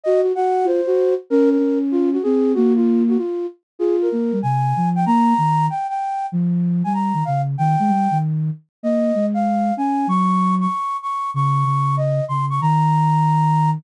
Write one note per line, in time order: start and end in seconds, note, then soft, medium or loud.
0.04 0.22 F#4 medium
0.04 0.21 D#5 medium
0.22 0.32 F#4 medium
0.35 0.67 F#4 medium
0.35 0.65 F#5 medium
0.64 0.81 F4 medium
0.64 1.14 C5 medium
0.87 1.15 F#4 medium
1.30 1.58 C#4 medium
1.30 1.49 A#4 loud
1.50 1.78 A#4 medium
1.58 2.18 C#4 medium
1.91 2.10 F4 loud
2.13 2.22 F#4 medium
2.23 2.54 C4 medium
2.23 2.52 G#4 medium
2.54 3.17 A#3 loud
2.54 2.73 F#4 loud
2.76 3.03 F4 medium
3.08 3.18 F#4 medium
3.18 3.46 F4 medium
3.79 4.09 F4 medium
3.79 3.96 G#4 medium
4.02 4.39 A#4 medium
4.12 4.31 A#3 medium
4.32 4.41 G3 medium
4.42 4.73 C3 medium
4.42 4.89 G#5 medium
4.76 5.05 F3 medium
4.95 5.05 G5 medium
5.06 5.34 A#3 medium
5.06 5.66 A#5 medium
5.38 5.69 D#3 medium
5.70 5.87 G5 medium
5.89 6.26 G5 medium
6.32 6.83 F3 medium
6.84 7.13 G3 medium
6.84 6.93 G#5 medium
6.94 7.24 A#5 medium
7.14 7.23 D#3 medium
7.25 7.56 C#3 medium
7.25 7.41 F5 medium
7.58 7.76 D#3 medium
7.58 8.18 G5 medium
7.79 7.90 G#3 medium
7.88 8.08 G3 medium
8.11 8.50 D#3 medium
8.83 9.12 A#3 medium
8.83 9.26 D#5 medium
9.15 9.72 G#3 medium
9.34 9.74 F5 medium
9.77 10.06 C#4 medium
9.77 10.08 G#5 medium
10.07 10.67 F#3 medium
10.07 10.55 C#6 medium
10.60 10.97 C#6 medium
11.02 11.30 C#6 medium
11.34 11.64 C#3 medium
11.34 11.96 C#6 medium
11.65 12.21 C#3 medium
11.97 12.25 D#5 medium
12.28 12.60 C#3 medium
12.28 12.45 C6 medium
12.50 12.60 C#6 medium
12.61 13.79 D#3 medium
12.61 13.70 A#5 medium